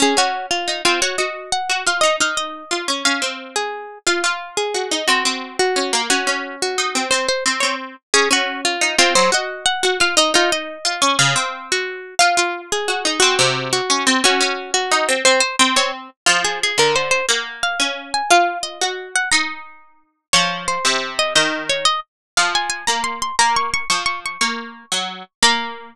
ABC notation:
X:1
M:6/8
L:1/8
Q:3/8=118
K:Db
V:1 name="Harpsichord"
A G2 F2 F | d e2 g2 f | e f e3 z | f3 A3 |
f3 A3 | G3 G3 | G3 G3 | c c z d z2 |
A G2 F2 F | c e2 g2 f | e F e3 z | f3 G3 |
f3 A3 | G3 G3 | G3 G3 | c c z d z2 |
[K:Bbm] F A A B c c | g2 f3 a | f2 e3 g | b5 z |
d2 c3 e | e2 d e z2 | f a a b c' c' | b d' d' d' d' d' |
d'6 | b6 |]
V:2 name="Harpsichord"
D D3 E C | G G3 G F | E E3 F D | D C4 z |
F F3 G E | C C3 D B, | D D3 E C | C z C C2 z |
D D3 E C | G, G3 G F | E E3 F D | D, C4 z |
F F3 G E | C C,3 D C | D D3 E C | C z C C2 z |
[K:Bbm] F,3 =D,3 | B,3 D3 | F3 G3 | E6 |
F,3 C,3 | E,3 z3 | F,3 B,3 | B,3 F,3 |
B,3 G,2 z | B,6 |]